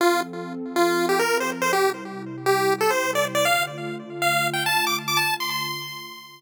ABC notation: X:1
M:4/4
L:1/16
Q:1/4=139
K:Dm
V:1 name="Lead 1 (square)"
F2 z5 F3 G B2 c z c | G2 z5 G3 A c2 d z d | f2 z5 f3 g a2 d' z d' | a2 c' c'9 z4 |]
V:2 name="Pad 2 (warm)"
[F,CA]16 | [C,G,E]16 | [D,A,F]16 | [D,A,F]16 |]